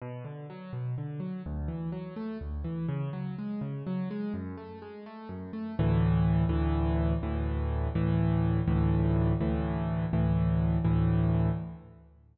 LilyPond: \new Staff { \time 6/8 \key b \minor \tempo 4. = 83 b,8 d8 fis8 b,8 d8 fis8 | d,8 e8 fis8 a8 d,8 e8 | cis8 fis8 gis8 cis8 fis8 gis8 | fis,8 a8 gis8 a8 fis,8 a8 |
\key d \major <d, a, e>4. <d, a, e>4. | <d, a, e>4. <d, a, e>4. | <d, a, e>4. <d, a, e>4. | <d, a, e>4. <d, a, e>4. | }